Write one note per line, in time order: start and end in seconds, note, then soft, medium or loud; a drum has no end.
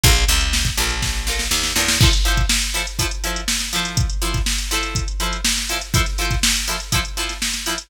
0.03 0.25 A#1 loud
0.03 0.12 D4 loud
0.03 0.12 F4 loud
0.03 0.12 A4 loud
0.03 0.12 A#4 loud
0.03 kick loud
0.03 closed hi-hat medium
0.16 closed hi-hat medium
0.28 0.70 C#2 medium
0.28 0.46 D4 medium
0.28 0.46 F4 loud
0.28 0.46 A4 medium
0.28 0.46 A#4 medium
0.28 snare soft
0.28 closed hi-hat medium
0.41 closed hi-hat medium
0.53 snare medium
0.65 kick medium
0.65 closed hi-hat medium
0.77 1.48 A#1 medium
0.77 0.95 D4 medium
0.77 0.95 F4 medium
0.77 0.95 A4 medium
0.77 0.95 A#4 loud
0.77 closed hi-hat medium
0.90 closed hi-hat medium
1.02 kick medium
1.02 snare medium
1.27 1.44 D4 medium
1.27 1.44 F4 loud
1.27 1.44 A4 medium
1.27 1.44 A#4 medium
1.27 snare medium
1.39 snare medium
1.51 1.73 D#2 medium
1.51 snare medium
1.63 snare medium
1.76 1.98 E2 medium
1.76 1.84 D4 medium
1.76 1.84 F4 loud
1.76 1.84 A4 medium
1.76 1.84 A#4 medium
1.76 snare medium
1.88 snare medium
2.01 2.10 F3 loud
2.01 2.10 E4 loud
2.01 2.10 A4 loud
2.01 2.10 C5 loud
2.01 kick loud
2.01 crash medium
2.13 closed hi-hat medium
2.25 2.42 F3 loud
2.25 2.42 E4 medium
2.25 2.42 A4 loud
2.25 2.42 C5 loud
2.25 closed hi-hat medium
2.37 kick medium
2.37 closed hi-hat medium
2.49 snare medium
2.62 closed hi-hat medium
2.74 2.83 F3 medium
2.74 2.83 E4 loud
2.74 2.83 A4 medium
2.74 2.83 C5 medium
2.74 closed hi-hat medium
2.87 closed hi-hat medium
2.99 3.08 F3 loud
2.99 3.08 E4 loud
2.99 3.08 A4 loud
2.99 3.08 C5 loud
2.99 kick medium
2.99 closed hi-hat medium
3.11 closed hi-hat medium
3.24 3.41 F3 medium
3.24 3.41 E4 medium
3.24 3.41 A4 medium
3.24 3.41 C5 loud
3.24 closed hi-hat medium
3.36 closed hi-hat medium
3.48 snare medium
3.60 snare soft
3.60 closed hi-hat medium
3.73 4.06 F3 loud
3.73 4.06 E4 loud
3.73 4.06 A4 loud
3.73 4.06 C5 loud
3.73 closed hi-hat medium
3.85 closed hi-hat medium
3.97 kick medium
3.97 closed hi-hat medium
4.10 closed hi-hat medium
4.22 4.39 F3 loud
4.22 4.39 E4 loud
4.22 4.39 A4 medium
4.22 4.39 C5 medium
4.22 closed hi-hat medium
4.34 kick medium
4.34 snare soft
4.34 closed hi-hat medium
4.46 snare medium
4.59 closed hi-hat medium
4.71 5.04 F3 loud
4.71 5.04 E4 loud
4.71 5.04 A4 loud
4.71 5.04 C5 loud
4.71 snare soft
4.71 closed hi-hat medium
4.83 closed hi-hat medium
4.95 kick medium
4.95 closed hi-hat medium
5.08 closed hi-hat medium
5.20 5.37 F3 medium
5.20 5.37 E4 medium
5.20 5.37 A4 medium
5.20 5.37 C5 medium
5.20 closed hi-hat medium
5.33 closed hi-hat medium
5.45 snare medium
5.57 snare soft
5.57 closed hi-hat medium
5.69 5.78 F3 medium
5.69 5.78 E4 medium
5.69 5.78 A4 loud
5.69 5.78 C5 loud
5.69 closed hi-hat medium
5.81 closed hi-hat medium
5.94 6.02 F3 loud
5.94 6.02 E4 loud
5.94 6.02 A4 loud
5.94 6.02 C5 loud
5.94 kick medium
5.94 closed hi-hat medium
6.06 snare soft
6.06 closed hi-hat medium
6.18 6.36 F3 medium
6.18 6.36 E4 medium
6.18 6.36 A4 medium
6.18 6.36 C5 loud
6.18 closed hi-hat medium
6.31 kick medium
6.31 snare soft
6.31 closed hi-hat medium
6.43 snare loud
6.56 closed hi-hat medium
6.68 6.76 F3 medium
6.68 6.76 E4 medium
6.68 6.76 A4 medium
6.68 6.76 C5 medium
6.68 closed hi-hat medium
6.80 closed hi-hat medium
6.92 7.01 F3 loud
6.92 7.01 E4 loud
6.92 7.01 A4 loud
6.92 7.01 C5 loud
6.92 kick medium
6.92 closed hi-hat medium
7.05 closed hi-hat medium
7.17 7.34 F3 medium
7.17 7.34 E4 medium
7.17 7.34 A4 medium
7.17 7.34 C5 medium
7.17 snare soft
7.17 closed hi-hat medium
7.29 snare soft
7.29 closed hi-hat medium
7.42 snare medium
7.53 snare soft
7.53 closed hi-hat medium
7.66 7.75 F3 loud
7.66 7.75 E4 loud
7.66 7.75 A4 medium
7.66 7.75 C5 medium
7.66 closed hi-hat medium
7.78 closed hi-hat medium